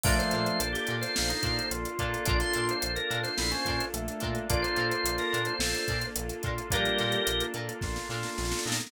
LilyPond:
<<
  \new Staff \with { instrumentName = "Drawbar Organ" } { \time 4/4 \key bes \mixolydian \tempo 4 = 108 d''16 c''8 c''8 g'8 c''4~ c''16 r4 | d''16 c'''8 c''8 bes'8 c''4~ c''16 r4 | d''16 c''8 c''8 bes'8 c''4~ c''16 r4 | <g' bes'>4. r2 r8 | }
  \new Staff \with { instrumentName = "Drawbar Organ" } { \time 4/4 \key bes \mixolydian <f a>4 d''4 bes16 ees'8. f'4 | <d' f'>4 d'4 e'16 des'8. a4 | <d' f'>2 a'8. r8. f'8 | <g bes>4 r4 f'8 f'4 ees'8 | }
  \new Staff \with { instrumentName = "Acoustic Guitar (steel)" } { \time 4/4 \key bes \mixolydian <d' f' a' bes'>8 <d' f' a' bes'>4 <d' f' a' bes'>4 <d' f' a' bes'>4 <d' f' a' bes'>8 | <d' f' a' bes'>8 <d' f' a' bes'>4 <d' f' a' bes'>4 <d' f' a' bes'>4 <d' f' a' bes'>8~ | <d' f' a' bes'>8 <d' f' a' bes'>4 <d' f' a' bes'>4 <d' f' a' bes'>4 <d' f' a' bes'>8 | <d' f' a' bes'>8 <d' f' a' bes'>4 <d' f' a' bes'>4 <d' f' a' bes'>4 <d' f' a' bes'>8 | }
  \new Staff \with { instrumentName = "Electric Piano 2" } { \time 4/4 \key bes \mixolydian <bes d' f' a'>2.~ <bes d' f' a'>8 <bes d' f' a'>8~ | <bes d' f' a'>1 | <bes d' f' a'>1 | <bes d' f' a'>1 | }
  \new Staff \with { instrumentName = "Synth Bass 1" } { \clef bass \time 4/4 \key bes \mixolydian bes,,8 bes,8 bes,,8 bes,8 bes,,8 bes,8 bes,,8 bes,8 | bes,,8 bes,8 bes,,8 bes,8 bes,,8 bes,8 bes,,8 bes,8 | bes,,8 bes,8 bes,,8 bes,8 bes,,8 bes,8 bes,,8 bes,8 | bes,,8 bes,8 bes,,8 bes,8 bes,,8 bes,8 bes,,8 bes,8 | }
  \new Staff \with { instrumentName = "Pad 2 (warm)" } { \time 4/4 \key bes \mixolydian <bes d' f' a'>1 | <bes d' f' a'>1 | <bes d' f' a'>1 | <bes d' f' a'>1 | }
  \new DrumStaff \with { instrumentName = "Drums" } \drummode { \time 4/4 <cymc bd>16 hh16 hh16 hh16 hh16 <hh sn>16 hh16 <hh sn>16 sn16 hh16 <hh bd>16 hh16 hh16 hh16 <hh bd>16 hh16 | <hh bd>16 <hh sn>16 hh16 hh16 hh16 hh16 hh16 <hh sn>16 sn16 hh16 <hh bd>16 hh16 hh16 hh16 <hh bd>16 hh16 | <hh bd>16 hh16 hh16 hh16 hh16 <hh sn>16 hh16 hh16 sn16 hh16 <hh bd>16 hh16 hh16 hh16 <hh bd>16 hh16 | <hh bd>16 hh16 <hh sn>16 hh16 hh16 hh16 hh16 hh16 <bd sn>16 sn16 sn16 sn16 sn32 sn32 sn32 sn32 sn32 sn32 sn32 sn32 | }
>>